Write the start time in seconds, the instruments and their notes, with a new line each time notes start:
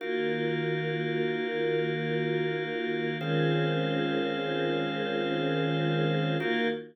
0.00 choir aahs D#3 A#3 F4 F#4, drawbar organ D#4 F#4 A#4 F5
3.19 choir aahs D#3 G#3 C4 C#4 F4, drawbar organ D#3 C#4 G#4 C5 F5
6.39 choir aahs D#3 A#3 F4 F#4, drawbar organ D#4 F#4 A#4 F5